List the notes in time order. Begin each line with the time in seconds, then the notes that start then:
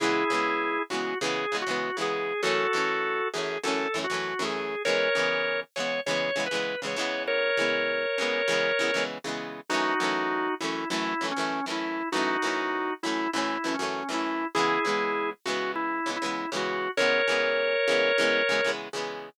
0.00 C#3 E3 G#3 B3 E4 G#4
0.30 C#3 E3 G#3
0.34 B3
0.90 C#3 E3 G#3 F#4
0.94 B3
1.21 C#3 E3 G#3 G#4
1.25 B3
1.52 C#3 E3 G#3
1.56 B3
1.62 F#4
1.67 C#3 E3 G#3
1.71 B3
1.97 C#3 E3 G#3
2.01 B3 G#4
2.43 F#2 E3 A3 F#4 A4
2.47 C#4
2.73 F#2 E3 A3
2.77 C#4
3.33 F#2 E3 A3 G#4
3.38 C#4
3.64 F#2 E3 A3 A4
3.68 C#4
3.94 F#2 E3 A3
3.98 C#4
4.04 F#4
4.10 F#2 E3 A3
4.14 C#4
4.39 F#2 E3 A3
4.43 C#4 G#4
4.85 C#3 E3 G#3 A#4 C#5
4.89 B3
5.15 C#3 E3 G#3
5.19 B3
5.76 C#3 E3 G#3 C#5
5.80 B3
6.06 C#3 E3 G#3 C#5
6.11 B3
6.36 C#3 E3 G#3
6.40 B3
6.46 B4
6.51 C#3 E3 G#3
6.55 B3
6.82 C#3 E3 G#3
6.86 B3 C#5
6.96 C#3 E3 G#3
7.01 B3
7.27 A#4 C#5
7.57 C#3 E3 G#3
7.61 B3
8.18 C#3 E3 G#3
8.22 B3
8.48 C#3 E3 G#3
8.52 B3
8.79 C#3 E3 G#3
8.83 B3
8.94 C#3 E3 G#3
8.98 B3
9.24 C#3 E3 G#3
9.28 B3
9.69 F#2 E3 A3 D#4 F#4
9.74 C#4
10.00 F#2 E3 A3
10.04 C#4
10.60 F#2 E3 A3 E4
10.65 C#4
10.90 F#2 E3 A3 E4
10.94 C#4
11.21 F#2 E3 A3
11.25 C#4
11.31 C#4
11.36 F#2 E3 A3
11.41 C#4
11.66 F#2 E3 A3
11.70 C#4 E4
12.12 F#2 E3 A3 D#4 F#4
12.17 C#4
12.42 F#2 E3 A3
12.46 C#4
13.03 F#2 E3 A3 E4
13.08 C#4
13.33 F#2 E3 A3 E4
13.38 C#4
13.64 F#2 E3 A3
13.68 C#4
13.74 C#4
13.79 F#2 E3 A3
13.83 C#4
14.09 F#2 E3 A3
14.13 C#4 E4
14.55 C#3 E3 G#3 E4 G#4
14.59 B3
14.85 C#3 E3 G#3
14.89 B3
15.45 C#3 E3 G#3 F#4
15.50 B3
15.76 E4
16.06 C#3 E3 G#3
16.10 B3
16.16 E4
16.22 C#3 E3 G#3
16.26 B3
16.52 C#3 E3 G#3
16.56 B3 F#4
16.97 C#3 E3 G#3 A#4 C#5
17.02 B3
17.28 C#3 E3 G#3
17.32 B3
17.88 C#3 E3 G#3
17.92 B3
18.18 C#3 E3 G#3
18.22 B3
18.49 C#3 E3 G#3
18.53 B3
18.64 C#3 E3 G#3
18.69 B3
18.93 C#3 E3 G#3
18.97 B3